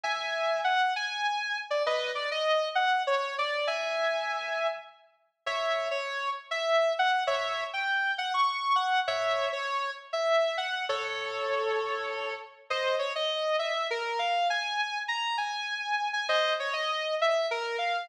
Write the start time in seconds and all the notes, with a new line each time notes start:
0.04 E5 G#5
0.64 F#5
0.96 G#5
1.70 D5
1.86 B4 D#5
2.15 D5
2.31 D#5
2.75 F#5
3.07 C#5
3.38 D5
3.67 E5 G#5
5.46 C#5 E5
5.91 C#5
6.51 E5
6.99 F#5
7.27 C#5 E5
7.73 G5
8.18 F#5
8.34 C#6
8.76 F#5
9.08 C#5 E5
9.53 C#5
10.13 E5
10.57 F#5
10.89 A4 C#5
12.70 C5 D#5
12.99 C#5
13.15 D#5
13.59 E5
13.90 A#4
14.19 F5
14.50 G#5
15.08 A#5
15.38 G#5
16.13 G#5
16.29 C5 D#5
16.60 C#5
16.73 D#5
17.21 E5
17.51 A#4
17.78 F5